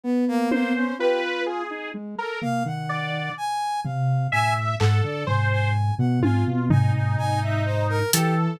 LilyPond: <<
  \new Staff \with { instrumentName = "Lead 2 (sawtooth)" } { \time 9/8 \tempo 4. = 42 b4 f'8. ees'16 aes16 r16 bes16 ees8. r8 c8 | a,8 aes,16 d16 aes,8. b,16 aes,16 b,16 aes,16 aes,16 aes,4 e8 | }
  \new Staff \with { instrumentName = "Lead 2 (sawtooth)" } { \time 9/8 r8 c''8 b'8 aes'8 r16 bes'16 r8 d''8 r4 | e''8 a'8 c''8 r8 f'8 ees'4. a'8 | }
  \new Staff \with { instrumentName = "Brass Section" } { \time 9/8 b16 bes16 bes16 des'16 g'16 r4 a'16 f''16 ges''8. aes''8 f''8 | aes''16 r16 ges''16 d''16 aes''16 aes''8 ges''16 aes''16 r16 aes''16 aes''16 aes''16 e''16 c''16 bes'16 g'16 r16 | }
  \new DrumStaff \with { instrumentName = "Drums" } \drummode { \time 9/8 r8 tommh4 r4 tomfh8 r4 tomfh8 | r8 hc8 tomfh8 r8 tommh8 tomfh8 r4 hh8 | }
>>